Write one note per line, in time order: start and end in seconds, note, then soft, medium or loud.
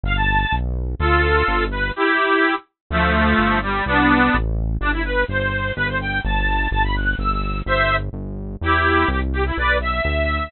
0.04 0.46 G1 medium
0.04 0.16 F5 loud
0.16 0.55 A5 medium
0.52 0.95 B1 medium
0.99 1.43 D2 medium
0.99 1.65 F4 medium
0.99 1.65 A4 medium
1.48 1.92 G1 medium
1.71 1.91 B4 medium
1.96 2.55 E4 medium
1.96 2.55 G4 loud
2.90 3.34 D2 medium
2.90 3.59 F3 medium
2.90 3.59 A3 loud
3.38 3.82 G1 medium
3.62 3.84 G3 medium
3.86 4.30 C2 medium
3.86 4.36 B3 medium
3.86 4.36 D4 loud
4.34 4.78 A1 medium
4.81 5.25 G1 medium
4.81 4.91 D4 loud
4.93 5.03 E4 medium
5.04 5.24 B4 medium
5.28 5.72 G1 medium
5.28 5.72 C5 medium
5.76 6.21 G1 medium
5.76 5.87 B4 loud
5.88 5.98 C5 medium
6.01 6.20 G5 medium
6.24 6.68 G1 medium
6.24 6.68 A5 medium
6.71 7.15 G1 medium
6.71 6.83 A5 medium
6.84 6.95 B5 medium
6.96 7.15 F#6 medium
7.19 7.62 G1 medium
7.19 7.59 E6 medium
7.66 8.10 G1 medium
7.66 7.96 C5 medium
7.66 7.96 E5 loud
8.13 8.57 G1 medium
8.61 9.05 E2 medium
8.61 9.09 E4 medium
8.61 9.09 G4 medium
9.08 9.52 C2 medium
9.08 9.20 G4 medium
9.33 9.44 G4 medium
9.46 9.57 E4 medium
9.57 10.01 B1 medium
9.57 9.77 B4 medium
9.57 9.77 D5 medium
9.81 10.50 E5 medium
10.05 10.49 D2 medium